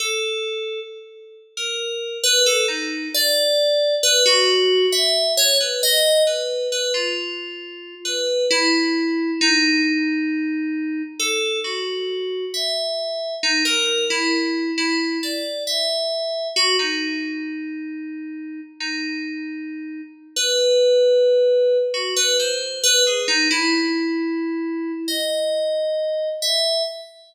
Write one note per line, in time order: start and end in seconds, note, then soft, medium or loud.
0.00 0.80 A4 medium
1.57 2.18 A#4 medium
2.24 2.44 B4 loud
2.46 2.66 A4 loud
2.68 3.09 D#4 medium
3.14 3.95 D5 loud
4.03 4.23 B4 loud
4.26 4.86 F#4 loud
4.92 5.33 E5 medium
5.37 5.57 C#5 loud
5.60 5.81 B4 medium
5.83 6.23 D#5 loud
6.27 6.67 B4 soft
6.72 6.92 B4 medium
6.94 7.95 F4 medium
8.05 8.45 B4 medium
8.51 9.31 E4 loud
9.41 11.02 D#4 loud
11.19 11.60 A4 medium
11.64 12.45 F#4 medium
12.54 13.35 E5 medium
13.43 13.63 D#4 medium
13.65 14.05 A#4 medium
14.10 14.71 E4 loud
14.78 15.18 E4 medium
15.23 15.63 D5 medium
15.67 16.48 E5 medium
16.56 16.76 F#4 loud
16.79 18.60 D#4 medium
18.80 20.01 D#4 medium
20.36 21.77 B4 medium
21.94 22.14 F#4 medium
22.16 22.37 B4 loud
22.40 22.80 C5 medium
22.84 23.04 B4 loud
23.07 23.27 G#4 medium
23.28 23.48 D#4 loud
23.51 24.92 E4 loud
25.08 26.29 D#5 medium
26.42 26.82 E5 medium